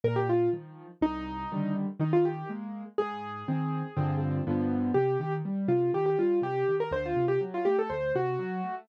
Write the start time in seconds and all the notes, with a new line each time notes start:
0.04 A#2 A#4
0.16 G4
0.29 F4
0.53 D#3 F3
1.01 C2 D#4
1.52 D3 D#3 G3
1.99 D#3 D#4
2.13 F4
2.25 G4
2.49 G#3 A#3
2.98 G#2 G#4
3.48 D#3 C4
3.97 G2 D3 F3 C4
4.47 G2 D3 F3 B3
4.94 C3 G4
5.20 D#3 G4
5.45 G3
5.68 C3 F4
5.94 D#3 G4
6.06 G4
6.19 G3 F4
6.42 C3 G4
6.68 D#3
6.80 A#4
6.91 D2 C5
7.06 F4
7.16 C3
7.28 G4
7.41 F#3
7.54 F4
7.65 A3 G4
7.79 A4
7.90 D2 C5
8.15 C3 F#4
8.39 F#3
8.64 A3